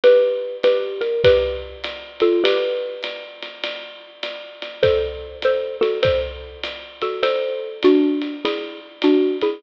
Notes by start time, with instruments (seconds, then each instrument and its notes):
0.04 xylophone G4 B4, ride
0.63 xylophone G4 B4, hi-hat pedal, ride
1.01 xylophone A#4, ride
1.24 xylophone G4 B4, kick, ride
1.84 hi-hat pedal, ride
2.20 xylophone F4 A4, ride
2.44 xylophone G4 B4, ride
3.03 hi-hat pedal, ride
3.42 ride
3.64 ride
4.23 hi-hat pedal, ride
4.62 ride
4.83 xylophone A4 C5, kick, ride
5.42 xylophone A4 C5, hi-hat pedal, ride
5.81 xylophone F#4 A4, ride
6.03 xylophone A4 C5, kick, ride
6.63 hi-hat pedal, ride
7.02 xylophone F#4 A4, ride
7.23 xylophone A4 C5, ride
7.83 xylophone D4 F#4, hi-hat pedal, ride
8.21 ride
8.45 xylophone E4 G#4, ride
9.02 xylophone D4 F#4, hi-hat pedal, ride
9.41 xylophone E4 G#4, ride